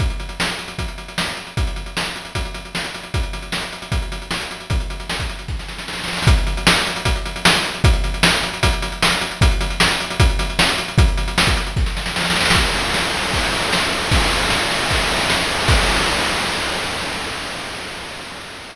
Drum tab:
CC |--------------------------------|--------------------------------|--------------------------------|--------------------------------|
RD |--------------------------------|--------------------------------|--------------------------------|--------------------------------|
HH |x-x-x-x---x-x-x-x-x-x-x---x-x-x-|x-x-x-x---x-x-x-x-x-x-x---x-x-x-|x-x-x-x---x-x-x-x-x-x-x---x-x-x-|x-x-x-x---x-x-x-----------------|
SD |--------o---------------o-------|--------o---------------o-------|--------o---------------o-------|--------o-------o-o-o-o-oooooooo|
BD |o---------------o---------------|o---------------o---------------|o---------------o---------------|o---------o-----o---------------|

CC |--------------------------------|--------------------------------|--------------------------------|--------------------------------|
RD |--------------------------------|--------------------------------|--------------------------------|--------------------------------|
HH |x-x-x-x---x-x-x-x-x-x-x---x-x-x-|x-x-x-x---x-x-x-x-x-x-x---x-x-x-|x-x-x-x---x-x-x-x-x-x-x---x-x-x-|x-x-x-x---x-x-x-----------------|
SD |--------o---------------o-------|--------o---------------o-------|--------o---------------o-------|--------o-------o-o-o-o-oooooooo|
BD |o---------------o---------------|o---------------o---------------|o---------------o---------------|o---------o-----o---------------|

CC |x-------------------------------|--------------------------------|x-------------------------------|
RD |--x-x-x---x-x-x-x-x-x-x---x-x-x-|x-x-x-x---x-x-x-x-x-x-x---x-x-x-|--------------------------------|
HH |--------------------------------|--------------------------------|--------------------------------|
SD |--------o---------------o-------|--------o---------------o-------|--------------------------------|
BD |o---------------o---------------|o---------------o---------------|o-------------------------------|